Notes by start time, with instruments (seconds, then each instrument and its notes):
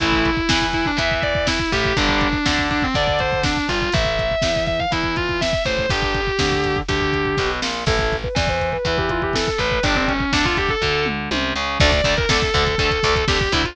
0.00 electric bass (finger) A1, overdriven guitar E3 A3, distortion guitar E4, kick, closed hi-hat
0.12 kick
0.25 kick, closed hi-hat
0.37 kick
0.49 electric bass (finger) E2, overdriven guitar E3, kick, snare
0.61 kick
0.73 distortion guitar E4, kick, closed hi-hat
0.86 distortion guitar D4, kick
0.97 electric bass (finger) E2, overdriven guitar E3, distortion guitar E5, kick, closed hi-hat
1.11 kick
1.23 distortion guitar D5, kick, closed hi-hat
1.35 kick
1.47 distortion guitar E4, kick, snare
1.59 kick
1.72 electric bass (finger) A1, overdriven guitar A2, distortion guitar G4, kick, closed hi-hat
1.85 kick
1.97 electric bass (finger) G1, overdriven guitar D3 G3, distortion guitar D4, kick, closed hi-hat
2.09 kick
2.21 kick, closed hi-hat
2.33 kick
2.46 electric bass (finger) D2, overdriven guitar D3, kick, snare
2.58 kick
2.70 distortion guitar D4, kick, closed hi-hat
2.82 distortion guitar C4, kick
2.94 electric bass (finger) D2, overdriven guitar D3, distortion guitar D5, kick, closed hi-hat
3.07 kick
3.19 distortion guitar C5, kick, closed hi-hat
3.32 kick
3.43 distortion guitar D4, kick, snare
3.57 kick
3.68 electric bass (finger) G1, overdriven guitar G2, distortion guitar F4, kick, closed hi-hat
3.82 kick
3.92 electric bass (finger) A1, overdriven guitar E4 A4, distortion guitar E5, kick, closed hi-hat
4.05 kick
4.19 kick, closed hi-hat
4.31 kick
4.42 electric bass (finger) E2, overdriven guitar E3, kick, snare
4.56 kick
4.67 distortion guitar E5, kick, closed hi-hat
4.80 distortion guitar F5, kick
4.91 electric bass (finger) E2, overdriven guitar E3, distortion guitar E4, kick, closed hi-hat
5.03 kick
5.16 distortion guitar F4, kick, closed hi-hat
5.29 kick
5.41 distortion guitar E5, kick, snare
5.53 kick
5.65 electric bass (finger) A1, overdriven guitar A2, distortion guitar C5, kick, closed hi-hat
5.78 kick
5.89 electric bass (finger) G1, overdriven guitar D4 G4, distortion guitar G4, kick, closed hi-hat
6.02 kick
6.14 kick, closed hi-hat
6.27 kick
6.39 electric bass (finger) D2, overdriven guitar D3, kick, snare
6.52 kick
6.64 kick, closed hi-hat
6.76 kick
6.88 electric bass (finger) D2, overdriven guitar D3, distortion guitar G4, kick, closed hi-hat
7.00 kick
7.13 kick, closed hi-hat
7.25 kick
7.37 electric bass (finger) B1, overdriven guitar B2, kick, snare
7.62 electric bass (finger) A#1, overdriven guitar A#2, snare
7.86 electric bass (finger) A1, overdriven guitar E4 A4, distortion guitar A4, kick, crash
7.99 kick
8.12 kick, closed hi-hat
8.24 distortion guitar B4, kick
8.35 electric bass (finger) E2, overdriven guitar E3, distortion guitar D5, kick, snare
8.47 distortion guitar C5, kick
8.60 kick, closed hi-hat
8.72 distortion guitar B4, kick
8.85 electric bass (finger) E2, overdriven guitar E3, kick, closed hi-hat
8.98 distortion guitar G4, kick
9.09 distortion guitar F4, kick, closed hi-hat
9.22 distortion guitar G4, kick
9.33 distortion guitar A4, kick, snare
9.47 distortion guitar A4, kick
9.58 electric bass (finger) A1, overdriven guitar A2, distortion guitar B4, kick, closed hi-hat
9.71 kick
9.83 electric bass (finger) G1, overdriven guitar D4 G4, distortion guitar D4, kick, closed hi-hat
9.95 distortion guitar C4, kick
10.08 distortion guitar C#4, kick, closed hi-hat
10.20 kick
10.33 electric bass (finger) D2, overdriven guitar D3, distortion guitar D4, kick, snare
10.45 distortion guitar F4, kick
10.57 distortion guitar G4, kick, closed hi-hat
10.69 distortion guitar A4, kick
10.82 electric bass (finger) D2, overdriven guitar D3, kick
11.06 mid tom
11.31 electric bass (finger) C2, overdriven guitar C3, high tom
11.56 electric bass (finger) C#2, overdriven guitar C#3
11.80 electric bass (finger) D2, overdriven guitar D3 A3, distortion guitar D5, kick, crash
11.92 kick, closed hi-hat
12.04 electric bass (finger) D2, overdriven guitar D3 A3, kick, closed hi-hat
12.17 distortion guitar A#4, kick, closed hi-hat
12.29 electric bass (finger) D2, overdriven guitar D3 A3, distortion guitar A4, kick, snare
12.42 kick, closed hi-hat
12.54 electric bass (finger) D2, overdriven guitar D3 A3, distortion guitar A4, kick, closed hi-hat
12.67 kick, closed hi-hat
12.78 electric bass (finger) D2, overdriven guitar D3 A3, distortion guitar A4, kick, closed hi-hat
12.91 kick, closed hi-hat
13.03 electric bass (finger) D2, overdriven guitar D3 A3, kick, closed hi-hat
13.16 kick, closed hi-hat
13.28 electric bass (finger) D2, overdriven guitar D3 A3, distortion guitar G4, kick, snare
13.40 distortion guitar G4, kick, closed hi-hat
13.52 electric bass (finger) D2, overdriven guitar D3 A3, distortion guitar E4, kick, closed hi-hat
13.64 distortion guitar F4, kick, closed hi-hat